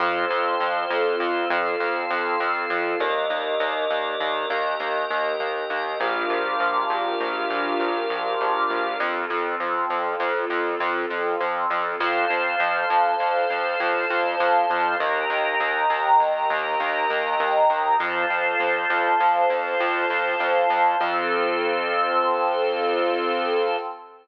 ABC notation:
X:1
M:5/4
L:1/8
Q:1/4=100
K:Fmix
V:1 name="Pad 2 (warm)"
[CFA]10 | z10 | [DFGB]10 | [CFA]10 |
[cfa]10 | [egb]10 | [cfa]10 | [CFA]10 |]
V:2 name="Drawbar Organ"
[Acf]5 [FAf]5 | [GBde]5 [GBeg]5 | [GBdf]10 | z10 |
[Acf]10 | [GBe]10 | [FAc]10 | [Acf]10 |]
V:3 name="Synth Bass 1" clef=bass
F,, F,, F,, F,, F,, F,, F,, F,, F,, F,, | E,, E,, E,, E,, E,, E,, E,, E,, E,, E,, | B,,, B,,, B,,, B,,, B,,, B,,, B,,, B,,, B,,, B,,, | F,, F,, F,, F,, F,, F,, F,, F,, F,, F,, |
F,, F,, F,, F,, F,, F,, F,, F,, F,, F,, | E,, E,, E,, E,, E,, E,, E,, E,, E,, E,, | F,, F,, F,, F,, F,, F,, F,, F,, F,, F,, | F,,10 |]